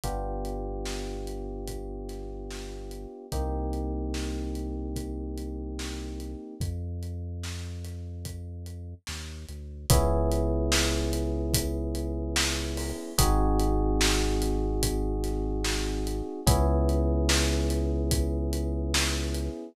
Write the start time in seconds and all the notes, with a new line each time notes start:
0.04 G1 B3 D4 F4 G4, kick, closed hi-hat
0.45 closed hi-hat
0.85 snare
1.27 closed hi-hat
1.67 kick, closed hi-hat
2.09 snare, closed hi-hat
2.51 snare
2.91 closed hi-hat
3.32 C2 A#3 C4 D#4 G4, kick, closed hi-hat
3.73 closed hi-hat
4.14 snare
4.55 closed hi-hat
4.96 kick, closed hi-hat
5.38 closed hi-hat
5.79 snare
6.20 closed hi-hat
6.60 F2, kick, closed hi-hat
7.03 closed hi-hat
7.43 snare
7.84 snare, closed hi-hat
8.25 kick, closed hi-hat
8.66 closed hi-hat
9.07 D#2, snare
9.48 D2, closed hi-hat
9.90 C#2 B3 C#4 E4 G#4, kick, closed hi-hat
10.32 closed hi-hat
10.72 snare
11.13 closed hi-hat
11.54 kick, closed hi-hat
11.95 closed hi-hat
12.36 snare
12.77 open hi-hat
13.18 G#1 C4 D#4 F#4 G#4, kick, closed hi-hat
13.59 closed hi-hat
14.01 snare
14.42 closed hi-hat
14.83 kick, closed hi-hat
15.24 snare, closed hi-hat
15.64 snare
16.07 closed hi-hat
16.46 C#2 B3 C#4 E4 G#4, kick, closed hi-hat
16.89 closed hi-hat
17.29 snare
17.70 closed hi-hat
18.11 kick, closed hi-hat
18.53 closed hi-hat
18.94 snare
19.34 closed hi-hat